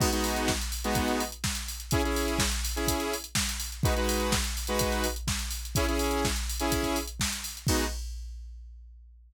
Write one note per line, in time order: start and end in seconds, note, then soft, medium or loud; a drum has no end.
0.00 0.10 G#3 loud
0.00 0.10 B3 loud
0.00 0.10 D#4 loud
0.00 0.10 F#4 loud
0.00 kick loud
0.00 crash loud
0.12 0.50 G#3 loud
0.12 0.50 B3 loud
0.12 0.50 D#4 loud
0.12 0.50 F#4 medium
0.12 closed hi-hat medium
0.24 open hi-hat medium
0.36 closed hi-hat medium
0.48 kick medium
0.48 snare loud
0.61 closed hi-hat medium
0.72 open hi-hat medium
0.84 1.23 G#3 loud
0.84 1.23 B3 loud
0.84 1.23 D#4 loud
0.84 1.23 F#4 medium
0.84 closed hi-hat medium
0.95 kick medium
0.95 closed hi-hat medium
1.08 closed hi-hat medium
1.20 open hi-hat medium
1.32 closed hi-hat medium
1.44 kick medium
1.44 snare loud
1.55 closed hi-hat medium
1.68 open hi-hat medium
1.80 closed hi-hat medium
1.91 2.02 C#4 loud
1.91 2.02 E4 loud
1.91 2.02 G#4 loud
1.91 kick loud
1.91 closed hi-hat loud
2.04 2.42 C#4 loud
2.04 2.42 E4 medium
2.04 2.42 G#4 loud
2.04 closed hi-hat medium
2.16 open hi-hat medium
2.28 closed hi-hat medium
2.39 kick medium
2.39 snare loud
2.51 closed hi-hat medium
2.65 open hi-hat medium
2.76 3.14 C#4 medium
2.76 3.14 E4 medium
2.76 3.14 G#4 loud
2.76 closed hi-hat medium
2.87 kick medium
2.87 closed hi-hat loud
3.00 closed hi-hat medium
3.14 open hi-hat medium
3.24 closed hi-hat medium
3.35 kick medium
3.35 snare loud
3.49 closed hi-hat medium
3.60 open hi-hat medium
3.72 closed hi-hat medium
3.83 3.94 G#3 loud
3.83 3.94 D#4 loud
3.83 3.94 F#4 loud
3.83 3.94 B4 loud
3.83 kick loud
3.83 closed hi-hat medium
3.96 4.34 G#3 loud
3.96 4.34 D#4 medium
3.96 4.34 F#4 loud
3.96 4.34 B4 loud
3.96 closed hi-hat medium
4.09 open hi-hat medium
4.20 closed hi-hat medium
4.32 kick medium
4.32 snare loud
4.44 closed hi-hat medium
4.57 open hi-hat medium
4.67 5.06 G#3 medium
4.67 5.06 D#4 medium
4.67 5.06 F#4 loud
4.67 5.06 B4 loud
4.67 closed hi-hat medium
4.79 kick medium
4.79 closed hi-hat loud
4.92 closed hi-hat medium
5.04 open hi-hat medium
5.16 closed hi-hat medium
5.28 kick medium
5.28 snare loud
5.39 closed hi-hat medium
5.50 open hi-hat medium
5.65 closed hi-hat medium
5.75 5.86 C#4 loud
5.75 5.86 E4 loud
5.75 5.86 G#4 loud
5.75 kick loud
5.75 closed hi-hat loud
5.88 6.26 C#4 loud
5.88 6.26 E4 medium
5.88 6.26 G#4 loud
5.88 closed hi-hat medium
5.99 open hi-hat medium
6.11 closed hi-hat medium
6.25 kick medium
6.25 snare loud
6.36 closed hi-hat medium
6.50 open hi-hat medium
6.59 6.98 C#4 loud
6.59 6.98 E4 loud
6.59 6.98 G#4 loud
6.59 closed hi-hat medium
6.72 kick medium
6.72 closed hi-hat loud
6.83 kick medium
6.83 closed hi-hat medium
6.96 open hi-hat medium
7.07 closed hi-hat medium
7.20 kick medium
7.20 snare loud
7.33 closed hi-hat medium
7.44 open hi-hat medium
7.57 closed hi-hat medium
7.67 7.85 G#3 loud
7.67 7.85 B3 loud
7.67 7.85 D#4 loud
7.67 7.85 F#4 loud
7.67 kick loud
7.67 crash loud